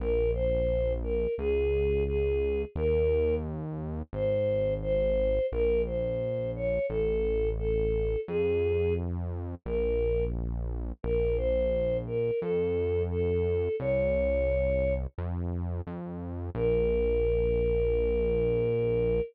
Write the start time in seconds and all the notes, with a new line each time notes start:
0.00 A#1 A#4
0.34 C5
1.03 A#4
1.38 C#2 G#4
2.07 G#4
2.75 D#2 A#4
4.13 G#1 C5
4.82 C5
5.52 A#1 A#4
5.86 C5
6.56 C#5
6.89 A1 A4
7.58 A4
8.28 F2 G#4
9.65 A#1 A#4
11.03 A#1 A#4
11.37 C5
12.07 A#4
12.41 F2 A4
13.10 A4
13.80 C2 C#5
15.18 F2
15.87 F2
16.55 A#1 A#4